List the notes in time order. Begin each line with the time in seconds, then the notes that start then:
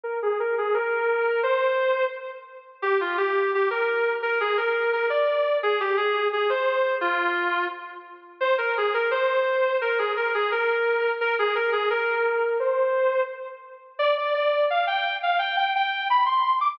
0.03 A#4
0.22 G#4
0.40 A#4
0.58 G#4
0.74 A#4
1.43 C5
2.82 G4
3.01 F4
3.17 G4
3.55 G4
3.70 A#4
4.22 A#4
4.40 G#4
4.57 A#4
4.93 A#4
5.10 D5
5.63 G#4
5.80 G4
5.97 G#4
6.33 G#4
6.49 C5
7.01 F4
8.41 C5
8.58 A#4
8.77 G#4
8.94 A#4
9.11 C5
9.81 A#4
9.98 G#4
10.17 A#4
10.34 G#4
10.52 A#4
11.21 A#4
11.39 G#4
11.55 A#4
11.72 G#4
11.90 A#4
12.60 C5
13.99 D5
14.17 D5
14.34 D5
14.70 F5
14.87 G5
15.23 F5
15.39 G5
15.57 G5
15.76 G5
16.10 B5
16.26 C6
16.61 D6